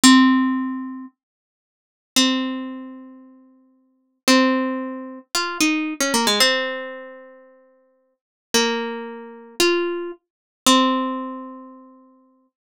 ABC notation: X:1
M:4/4
L:1/16
Q:1/4=113
K:F
V:1 name="Pizzicato Strings"
C8 z8 | [K:Fm] C16 | C8 F2 E3 D B, A, | C16 |
B,8 F4 z4 | [K:F] C16 |]